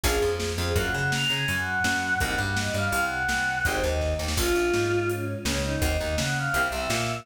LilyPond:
<<
  \new Staff \with { instrumentName = "Choir Aahs" } { \time 2/4 \key bes \minor \tempo 4 = 166 aes'8. aes'16 r8 c''16 aes'16 | \time 4/4 ges''8 ges''8 bes''8 aes''16 aes''8 ges''4.~ ges''16 | ges''8 ges''8 ees''8 f''16 f''8 ges''4.~ ges''16 | \time 2/4 c''8 ees''4 r8 |
\time 4/4 f'2 des'8 r16 des'8 des'16 ees'16 ees'16 | ees''8 ees''8 ges''8 f''16 f''8 e''4.~ e''16 | }
  \new Staff \with { instrumentName = "Electric Piano 2" } { \time 2/4 \key bes \minor <bes des' f' aes'>8 f4 f8 | \time 4/4 <bes des' f' ges'>8 des'4 des'8 ges4 ges4 | <bes c' ees' ges'>8 g4 g8 c4 c4 | \time 2/4 <aes c' ees' g'>8 ees4 ees8 |
\time 4/4 <bes des' f'>16 r16 bes8 aes2 des4 | <bes c' ees' ges'>16 r16 ees8 des'4 <bes c' e' g'>16 r16 c8 bes4 | }
  \new Staff \with { instrumentName = "Electric Bass (finger)" } { \clef bass \time 2/4 \key bes \minor bes,,8 f,4 f,8 | \time 4/4 ges,8 des4 des8 ges,4 ges,4 | c,8 g,4 g,8 c,4 c,4 | \time 2/4 aes,,8 ees,4 ees,8 |
\time 4/4 bes,,8 bes,,8 aes,2 des,4 | ees,8 ees,8 des4 c,8 c,8 bes,4 | }
  \new DrumStaff \with { instrumentName = "Drums" } \drummode { \time 2/4 <cymc bd>4 sn4 | \time 4/4 <hh bd>4 sn4 hh4 sn4 | <hh bd>4 sn4 hh4 sn4 | \time 2/4 <hh bd>4 <bd sn>8 sn16 sn16 |
\time 4/4 <cymc bd>4 sn4 hh4 sn4 | <hh bd>4 sn4 hh4 sn4 | }
>>